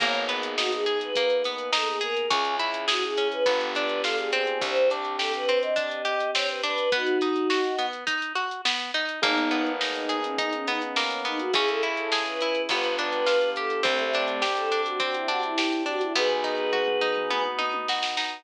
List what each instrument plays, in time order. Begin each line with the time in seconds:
0.00 electric bass (finger) G#1, acoustic guitar (steel) A#3, acoustic grand piano A#3 B3 D#4 G#4, choir aahs C#5, kick, closed hi-hat
0.14 closed hi-hat
0.29 acoustic guitar (steel) B3, closed hi-hat
0.43 closed hi-hat
0.57 acoustic guitar (steel) D#4, choir aahs F#4, snare
0.72 choir aahs G#4, closed hi-hat
0.86 acoustic guitar (steel) G#4, closed hi-hat
1.01 choir aahs B4, closed hi-hat
1.15 acoustic guitar (steel) A#3, kick, closed hi-hat
1.30 closed hi-hat
1.44 acoustic guitar (steel) B3, closed hi-hat
1.58 closed hi-hat
1.72 acoustic guitar (steel) D#4, choir aahs A4, snare
1.87 choir aahs G#4, closed hi-hat
2.01 acoustic guitar (steel) G#4, choir aahs A#4, closed hi-hat
2.17 closed hi-hat
2.31 electric bass (finger) C#2, acoustic guitar (steel) C#4, acoustic grand piano C#4 E4 G#4, choir aahs G#4, kick, closed hi-hat
2.45 closed hi-hat
2.59 acoustic guitar (steel) E4, closed hi-hat
2.74 closed hi-hat
2.88 choir aahs F#4, acoustic guitar (steel) G#4, snare
3.03 choir aahs G#4, closed hi-hat
3.17 acoustic guitar (steel) C#4, closed hi-hat
3.32 choir aahs B4, closed hi-hat
3.46 electric bass (finger) G1, acoustic guitar (steel) B3, acoustic grand piano B3 D4 F4 G4, kick, closed hi-hat
3.61 closed hi-hat
3.75 acoustic guitar (steel) D4, closed hi-hat
3.89 closed hi-hat
4.03 acoustic guitar (steel) F4, choir aahs A4, snare
4.16 choir aahs G#4, closed hi-hat
4.31 acoustic guitar (steel) C4, choir aahs G#4, closed hi-hat
4.47 closed hi-hat
4.61 electric bass (finger) C2, acoustic grand piano C4 D4 G4, choir aahs C5, kick, closed hi-hat
4.76 closed hi-hat
4.90 acoustic guitar (steel) D4, closed hi-hat
5.05 closed hi-hat
5.18 acoustic guitar (steel) G4, choir aahs A4, snare
5.34 choir aahs B4, closed hi-hat
5.49 acoustic guitar (steel) C4, closed hi-hat
5.62 choir aahs D#5, closed hi-hat
5.76 acoustic guitar (steel) D4, kick, closed hi-hat
5.91 closed hi-hat
6.05 acoustic guitar (steel) G4, closed hi-hat
6.20 closed hi-hat
6.34 acoustic guitar (steel) C4, choir aahs C#5, snare
6.49 choir aahs B4, closed hi-hat
6.62 acoustic guitar (steel) D4, choir aahs B4, closed hi-hat
6.78 closed hi-hat
6.92 acoustic guitar (steel) B3, choir aahs D#4 F#4, kick, closed hi-hat
7.06 closed hi-hat
7.21 acoustic guitar (steel) D#4, closed hi-hat
7.36 closed hi-hat
7.50 acoustic guitar (steel) F#4, snare
7.64 closed hi-hat
7.78 acoustic guitar (steel) B3, closed hi-hat
7.93 closed hi-hat
8.07 acoustic guitar (steel) D#4, kick, closed hi-hat
8.22 closed hi-hat
8.35 acoustic guitar (steel) F#4, closed hi-hat
8.51 closed hi-hat
8.65 acoustic guitar (steel) B3, snare
8.80 closed hi-hat
8.94 acoustic guitar (steel) D#4, closed hi-hat
9.09 closed hi-hat
9.22 electric bass (finger) G#1, acoustic grand piano A#3 B3 D#4 G#4, acoustic guitar (steel) A#3, choir aahs B3 D#4, kick, closed hi-hat
9.38 closed hi-hat
9.51 acoustic guitar (steel) B3, closed hi-hat
9.66 closed hi-hat
9.81 acoustic guitar (steel) D#4, snare
9.94 choir aahs D#4, closed hi-hat
10.09 acoustic guitar (steel) G#4, closed hi-hat
10.22 choir aahs C#4, closed hi-hat
10.38 acoustic guitar (steel) D#4, choir aahs D#4, kick, closed hi-hat
10.53 choir aahs C#4, closed hi-hat
10.67 acoustic guitar (steel) B3, choir aahs D#4, closed hi-hat
10.81 choir aahs C#4, closed hi-hat
10.96 acoustic guitar (steel) A#3, snare
11.10 closed hi-hat
11.25 acoustic guitar (steel) B3, choir aahs D#4, closed hi-hat
11.39 choir aahs F#4, closed hi-hat
11.53 electric bass (finger) C#2, acoustic grand piano C#4 E4 G#4, acoustic guitar (steel) C#4, choir aahs G#4, kick, closed hi-hat
11.67 choir aahs A4, closed hi-hat
11.83 acoustic guitar (steel) E4, closed hi-hat
11.97 choir aahs A4, closed hi-hat
12.12 acoustic guitar (steel) G#4, snare
12.25 choir aahs B4, closed hi-hat
12.41 acoustic guitar (steel) E4, closed hi-hat
12.55 closed hi-hat
12.69 electric bass (finger) G1, acoustic guitar (steel) B3, acoustic grand piano B3 D4 F4 G4, choir aahs B4, kick, closed hi-hat
12.84 closed hi-hat
12.97 acoustic guitar (steel) D4, choir aahs B4, closed hi-hat
13.12 closed hi-hat
13.26 acoustic guitar (steel) F4, snare
13.41 closed hi-hat
13.56 acoustic guitar (steel) G4, choir aahs A4, closed hi-hat
13.70 closed hi-hat
13.83 electric bass (finger) C2, choir aahs A3 C4, acoustic guitar (steel) C4, acoustic grand piano C4 D4 G4, kick, closed hi-hat
13.99 closed hi-hat
14.13 acoustic guitar (steel) D4, closed hi-hat
14.28 closed hi-hat
14.42 acoustic guitar (steel) G4, snare
14.56 choir aahs A4, closed hi-hat
14.72 acoustic guitar (steel) D4, closed hi-hat
14.86 choir aahs F#4, closed hi-hat
15.00 acoustic guitar (steel) C4, choir aahs F#4, kick, closed hi-hat
15.14 choir aahs E4, closed hi-hat
15.27 acoustic guitar (steel) D4, choir aahs F#4, closed hi-hat
15.42 choir aahs E4, closed hi-hat
15.58 acoustic guitar (steel) G4, snare
15.72 closed hi-hat
15.86 acoustic guitar (steel) D4, choir aahs F#4, closed hi-hat
16.01 choir aahs E4, closed hi-hat
16.15 electric bass (finger) B1, acoustic guitar (steel) B3, acoustic grand piano B3 D#4 F#4, choir aahs G#4 B4, kick, floor tom
16.30 floor tom
16.44 acoustic guitar (steel) D#4, floor tom
16.73 acoustic guitar (steel) F#4, mid tom
16.87 mid tom
17.01 acoustic guitar (steel) D#4, mid tom
17.16 mid tom
17.30 acoustic guitar (steel) B3, high tom
17.45 high tom
17.59 acoustic guitar (steel) D#4, high tom
17.74 high tom
17.88 acoustic guitar (steel) F#4, snare
18.03 snare
18.17 acoustic guitar (steel) D#4, snare